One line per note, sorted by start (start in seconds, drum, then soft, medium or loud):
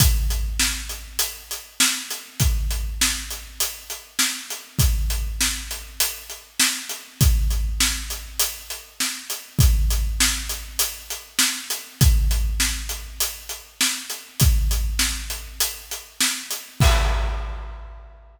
0.00 kick loud
0.00 closed hi-hat loud
0.30 closed hi-hat medium
0.60 snare loud
0.89 closed hi-hat medium
1.19 closed hi-hat loud
1.51 closed hi-hat medium
1.80 snare loud
2.10 closed hi-hat medium
2.40 kick medium
2.40 closed hi-hat medium
2.71 closed hi-hat medium
3.01 snare loud
3.31 closed hi-hat medium
3.60 closed hi-hat loud
3.90 closed hi-hat medium
4.19 snare loud
4.50 closed hi-hat medium
4.79 kick loud
4.79 closed hi-hat loud
5.10 closed hi-hat medium
5.41 snare loud
5.71 closed hi-hat medium
6.00 closed hi-hat loud
6.30 closed hi-hat medium
6.60 snare loud
6.89 closed hi-hat medium
7.21 kick loud
7.21 closed hi-hat loud
7.51 closed hi-hat medium
7.80 snare loud
8.10 closed hi-hat medium
8.40 closed hi-hat loud
8.70 closed hi-hat medium
9.00 snare medium
9.30 closed hi-hat medium
9.59 kick loud
9.59 closed hi-hat medium
9.90 closed hi-hat medium
10.20 snare loud
10.49 closed hi-hat medium
10.79 closed hi-hat loud
11.10 closed hi-hat medium
11.39 snare loud
11.70 closed hi-hat medium
12.01 kick loud
12.01 closed hi-hat loud
12.31 closed hi-hat medium
12.60 snare loud
12.89 closed hi-hat medium
13.20 closed hi-hat loud
13.49 closed hi-hat medium
13.81 snare loud
14.10 closed hi-hat medium
14.40 kick loud
14.40 closed hi-hat loud
14.71 closed hi-hat medium
14.99 snare loud
15.30 closed hi-hat medium
15.60 closed hi-hat loud
15.91 closed hi-hat medium
16.21 snare loud
16.51 closed hi-hat medium
16.80 kick loud
16.80 crash loud